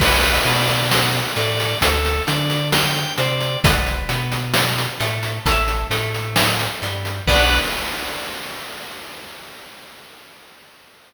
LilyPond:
<<
  \new Staff \with { instrumentName = "Overdriven Guitar" } { \time 4/4 \key b \dorian \tempo 4 = 66 <b' d'' fis''>8 b4 a8 r8 d'4 c'8 | <b' d'' fis''>8 b4 a8 <a' cis'' e''>8 a4 g8 | <b d' fis'>4 r2. | }
  \new Staff \with { instrumentName = "Drawbar Organ" } { \time 4/4 \key b \dorian b'8 d''8 fis''8 d''8 a'8 d''8 g''8 d''8 | r1 | <b' d'' fis''>4 r2. | }
  \new Staff \with { instrumentName = "Synth Bass 2" } { \clef bass \time 4/4 \key b \dorian b,,8 b,4 a,8 d,8 d4 c8 | b,,8 b,4 a,8 a,,8 a,4 g,8 | b,,4 r2. | }
  \new DrumStaff \with { instrumentName = "Drums" } \drummode { \time 4/4 <cymc bd>16 hh16 <hh sn>16 hh16 sn16 hh16 hh16 hh16 <hh bd>16 hh16 <hh sn>16 hh16 sn16 hh16 hh16 hh16 | <hh bd>16 hh16 hh16 hh16 sn16 hh16 hh16 hh16 <hh bd>16 hh16 <hh sn>16 hh16 sn16 hh16 hh16 hh16 | <cymc bd>4 r4 r4 r4 | }
>>